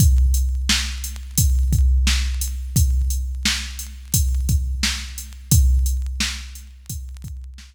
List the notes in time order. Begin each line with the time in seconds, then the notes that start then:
0.00 kick, closed hi-hat
0.34 closed hi-hat
0.69 snare
1.04 closed hi-hat
1.37 kick, closed hi-hat
1.73 kick, closed hi-hat
2.07 snare
2.41 closed hi-hat
2.76 kick, closed hi-hat
3.10 closed hi-hat
3.45 snare
3.79 closed hi-hat
4.14 kick, closed hi-hat
4.49 kick, closed hi-hat
4.83 snare
5.18 closed hi-hat
5.51 kick, closed hi-hat
5.86 closed hi-hat
6.20 snare
6.55 closed hi-hat
6.90 kick, closed hi-hat
7.24 kick, closed hi-hat
7.58 snare